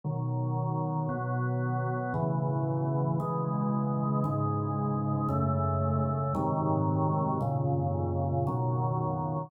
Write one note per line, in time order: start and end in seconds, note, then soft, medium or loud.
0.04 1.08 B2 medium
0.04 1.09 D#3 medium
0.04 1.08 F#3 medium
1.09 2.13 B2 medium
1.09 2.13 F#3 medium
1.09 2.13 B3 medium
2.14 3.18 A2 medium
2.14 3.18 C#3 medium
2.14 3.18 E3 medium
3.20 4.23 C#3 medium
3.20 4.24 E3 medium
3.20 4.23 G#3 medium
4.24 5.28 G#2 medium
4.24 5.28 C#3 medium
4.24 5.28 G#3 medium
5.29 6.33 F#2 medium
5.29 6.33 C#3 medium
5.29 6.33 A3 medium
6.35 7.39 G#2 medium
6.35 7.39 C3 medium
6.35 7.39 D#3 medium
6.35 7.39 F#3 medium
7.41 8.45 F#2 medium
7.41 8.45 A#2 medium
7.41 8.45 C#3 medium
8.47 9.50 B2 medium
8.47 9.50 D#3 medium
8.47 9.50 F#3 medium